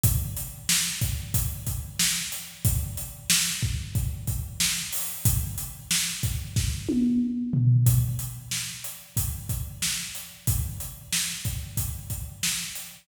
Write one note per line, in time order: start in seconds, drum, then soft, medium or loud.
0.04 kick loud
0.04 closed hi-hat loud
0.37 closed hi-hat medium
0.69 snare loud
1.01 kick medium
1.01 closed hi-hat medium
1.34 kick medium
1.34 closed hi-hat loud
1.67 kick medium
1.67 closed hi-hat medium
1.99 snare loud
2.32 closed hi-hat medium
2.65 kick loud
2.65 closed hi-hat loud
2.97 closed hi-hat medium
3.30 snare loud
3.63 kick loud
3.95 kick loud
3.95 closed hi-hat medium
4.27 kick medium
4.27 closed hi-hat medium
4.60 snare loud
4.93 open hi-hat medium
5.25 kick loud
5.25 closed hi-hat loud
5.58 closed hi-hat medium
5.91 snare loud
6.23 kick medium
6.23 closed hi-hat medium
6.56 kick loud
6.56 snare medium
6.89 high tom loud
7.53 floor tom loud
7.86 kick loud
7.86 closed hi-hat loud
8.19 closed hi-hat medium
8.51 snare medium
8.84 closed hi-hat medium
9.17 kick medium
9.17 closed hi-hat loud
9.49 kick medium
9.49 closed hi-hat medium
9.82 snare loud
10.15 closed hi-hat medium
10.47 kick loud
10.47 closed hi-hat loud
10.80 closed hi-hat medium
11.13 snare loud
11.45 kick medium
11.45 closed hi-hat medium
11.77 kick medium
11.77 closed hi-hat medium
12.10 kick medium
12.10 closed hi-hat medium
12.43 snare loud
12.75 closed hi-hat medium